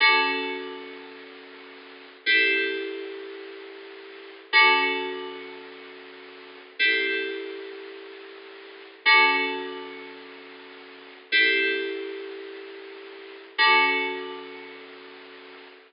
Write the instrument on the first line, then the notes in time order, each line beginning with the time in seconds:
electric piano 2
0.00 D3 C#4 F#4 A4
2.26 C4 E4 G4 A4
4.53 D3 C#4 F#4 A4
6.79 C4 E4 G4 A4
9.05 D3 C#4 F#4 A4
11.32 C4 E4 G4 A4
13.58 D3 C#4 F#4 A4